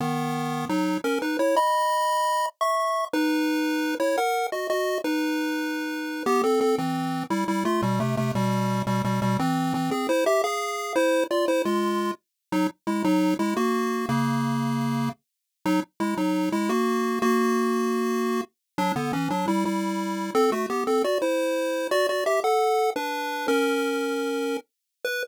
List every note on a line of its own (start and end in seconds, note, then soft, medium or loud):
0.00 0.65 D#3 medium
0.00 0.65 B3 medium
0.69 0.98 F#3 medium
0.69 0.98 D#4 medium
1.04 1.19 C#4 medium
1.04 1.19 A#4 medium
1.22 1.37 D#4 medium
1.22 1.37 B4 medium
1.39 1.55 E4 medium
1.39 1.55 C#5 medium
1.56 2.46 D#5 medium
1.56 2.46 B5 loud
2.61 3.05 E5 medium
2.61 3.05 C#6 medium
3.13 3.95 D#4 medium
3.13 3.95 B4 loud
4.00 4.16 E4 medium
4.00 4.16 C#5 medium
4.18 4.47 A#4 medium
4.18 4.47 F#5 medium
4.52 4.67 F#4 medium
4.52 4.67 D#5 medium
4.70 4.98 F#4 medium
4.70 4.98 D#5 medium
5.04 6.23 D#4 medium
5.04 6.23 B4 medium
6.26 6.42 B3 loud
6.26 6.42 G4 loud
6.44 6.60 C4 medium
6.44 6.60 A4 medium
6.61 6.76 C4 medium
6.61 6.76 A4 medium
6.78 7.24 E3 medium
6.78 7.24 C4 medium
7.30 7.44 G3 medium
7.30 7.44 E4 medium
7.48 7.64 G3 medium
7.48 7.64 E4 medium
7.65 7.81 A3 medium
7.65 7.81 F4 medium
7.82 7.99 B2 medium
7.82 7.99 G3 medium
8.00 8.16 C3 medium
8.00 8.16 A3 medium
8.17 8.32 C3 medium
8.17 8.32 A3 medium
8.35 8.82 B2 medium
8.35 8.82 G3 medium
8.87 9.02 B2 medium
8.87 9.02 G3 medium
9.04 9.20 B2 medium
9.04 9.20 G3 medium
9.22 9.37 B2 medium
9.22 9.37 G3 medium
9.39 9.73 E3 medium
9.39 9.73 C4 medium
9.74 9.90 E3 medium
9.74 9.90 C4 medium
9.91 10.07 C4 medium
9.91 10.07 G#4 medium
10.09 10.24 E4 medium
10.09 10.24 C5 medium
10.26 10.42 G4 medium
10.26 10.42 E5 medium
10.44 10.93 G#4 medium
10.44 10.93 F5 medium
10.96 11.24 E4 medium
10.96 11.24 C5 loud
11.31 11.46 F4 medium
11.31 11.46 D5 medium
11.48 11.62 E4 medium
11.48 11.62 C5 medium
11.65 12.11 G#3 medium
11.65 12.11 F4 medium
12.52 12.67 F#3 medium
12.52 12.67 D#4 loud
12.87 13.03 G#3 medium
12.87 13.03 E4 medium
13.04 13.34 F#3 medium
13.04 13.34 D#4 medium
13.39 13.54 G#3 medium
13.39 13.54 E4 medium
13.57 14.06 A#3 medium
13.57 14.06 F#4 medium
14.09 15.09 C#3 medium
14.09 15.09 A#3 medium
15.66 15.80 F#3 medium
15.66 15.80 D#4 loud
16.00 16.15 G#3 medium
16.00 16.15 E4 medium
16.17 16.49 F#3 medium
16.17 16.49 D#4 medium
16.52 16.69 G#3 medium
16.52 16.69 E4 medium
16.69 17.19 A#3 medium
16.69 17.19 F#4 medium
17.22 18.41 A#3 medium
17.22 18.41 F#4 loud
18.78 18.92 F#3 medium
18.78 18.92 D4 loud
18.96 19.12 D3 medium
18.96 19.12 B3 medium
19.13 19.29 E3 medium
19.13 19.29 C#4 medium
19.30 19.46 F#3 medium
19.30 19.46 D4 medium
19.48 19.64 G3 medium
19.48 19.64 E4 medium
19.65 20.31 G3 medium
19.65 20.31 E4 medium
20.35 20.51 C4 medium
20.35 20.51 A4 loud
20.52 20.66 A3 medium
20.52 20.66 F#4 medium
20.70 20.84 B3 medium
20.70 20.84 G4 medium
20.87 21.03 C4 medium
20.87 21.03 A4 medium
21.04 21.18 F#4 medium
21.04 21.18 D5 medium
21.22 21.87 E4 medium
21.22 21.87 C5 medium
21.91 22.07 F#4 medium
21.91 22.07 D5 loud
22.09 22.24 F#4 medium
22.09 22.24 D5 medium
22.26 22.40 G4 medium
22.26 22.40 E5 medium
22.44 22.90 A4 medium
22.44 22.90 F#5 medium
22.96 23.47 D4 medium
22.96 23.47 B4 medium
23.48 24.57 C#4 medium
23.48 24.57 A#4 medium
25.04 25.23 B4 loud